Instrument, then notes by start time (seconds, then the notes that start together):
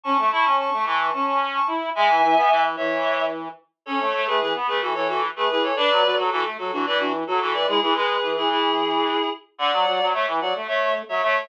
clarinet
0.04 C#4 A5 C#6
0.19 A3
0.31 E4 A5 C#6
0.45 C#4
0.58 A5 C#6
0.73 A3
0.85 E3 A5 C#6
1.00 A5 C#6
1.13 C#4 A5 C#6
1.26 A5 C#6
1.54 A5 C#6
1.67 E4
1.95 G#3 E5 G#5
2.09 E3
2.22 E3
2.36 B3
2.50 E3
2.76 E3 C#5 E5
3.86 C#4 A4 C#5
4.00 A3
4.14 A3
4.27 A3 G#4 B4
4.40 E3 G#4 B4
4.54 B3
4.67 A3 G#4 B4
4.81 E3 F#4 A4
4.95 E3 A4 C#5
5.08 F#4 A4
5.36 A3 G#4 B4
5.50 E3 G#4 B4
5.63 A4 C#5
5.76 D4 B4 D5
5.90 F#3
6.04 F#3
6.17 F#3 F#4 A4
6.31 E3 F#4 A4
6.45 A3
6.58 F#3 F#4 A4
6.72 E3 D4 F#4
6.86 E3 B4 D5
6.99 D4 F#4
7.27 F#3 F#4 A4
7.40 E3 F#4 A4
7.54 B4 D5
7.67 G#3 E4 G#4
7.81 E3 E4 G#4
7.95 G#3 G#4 B4
8.22 E3
8.36 E4 G#4
8.50 E4 G#4
9.58 D3 D5 F#5
9.72 F#3
9.86 F#3
10.00 F#3
10.13 A3 C#5 E5
10.27 E3
10.41 F#3 D5 F#5
10.55 A3
10.68 A3 C#5 E5
11.09 F#3 C#5 E5
11.22 A3 C#5 E5